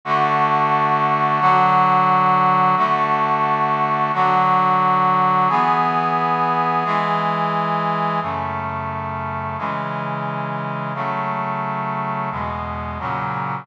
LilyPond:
\new Staff { \time 4/4 \key a \major \tempo 4 = 88 <d a fis'>2 <d fis fis'>2 | <d a fis'>2 <d fis fis'>2 | <e b gis'>2 <e gis gis'>2 | \key fis \minor <fis, cis a>2 <cis e gis>2 |
<cis fis a>2 <e, b, gis>4 <ais, cis fis>4 | }